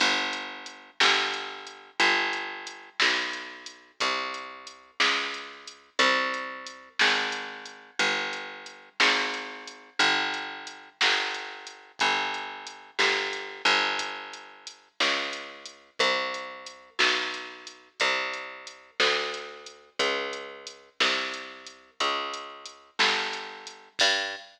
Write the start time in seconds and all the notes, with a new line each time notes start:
0.00 G1, kick, crash
0.33 closed hi-hat
0.66 closed hi-hat
1.00 G1, snare
1.34 closed hi-hat
1.67 closed hi-hat
2.00 G1, kick, closed hi-hat
2.33 closed hi-hat
2.67 closed hi-hat
3.00 B1, snare
3.33 closed hi-hat
3.66 closed hi-hat
4.00 C2, kick, closed hi-hat
4.34 closed hi-hat
4.67 closed hi-hat
5.00 C#2, snare
5.34 closed hi-hat
5.68 closed hi-hat
5.99 C2, kick, closed hi-hat
6.34 closed hi-hat
6.67 closed hi-hat
6.99 G#1, snare
7.32 closed hi-hat
7.66 closed hi-hat
7.99 G1, kick, closed hi-hat
8.33 closed hi-hat
8.66 closed hi-hat
9.00 G#1, snare
9.34 closed hi-hat
9.68 closed hi-hat
9.99 G1, kick, closed hi-hat
10.34 closed hi-hat
10.67 closed hi-hat
11.01 G1, snare
11.34 closed hi-hat
11.67 closed hi-hat
11.99 G1, kick, closed hi-hat
12.34 closed hi-hat
12.67 closed hi-hat
12.99 G1, snare
13.33 closed hi-hat
13.65 G1, closed hi-hat
13.99 kick, closed hi-hat
14.33 closed hi-hat
14.67 closed hi-hat
15.00 C#2, snare
15.33 closed hi-hat
15.66 closed hi-hat
15.99 C2, kick, closed hi-hat
16.34 closed hi-hat
16.66 closed hi-hat
16.99 B1, snare
17.34 closed hi-hat
17.67 closed hi-hat
18.00 C2, kick, closed hi-hat
18.33 closed hi-hat
18.67 closed hi-hat
19.00 D2, snare
19.34 closed hi-hat
19.66 closed hi-hat
19.99 C#2, kick, closed hi-hat
20.33 closed hi-hat
20.67 closed hi-hat
21.00 C2, snare
21.34 closed hi-hat
21.67 closed hi-hat
22.00 C#2, kick, closed hi-hat
22.33 closed hi-hat
22.66 closed hi-hat
22.99 G1, snare
23.33 closed hi-hat
23.67 closed hi-hat
23.99 G2, kick, crash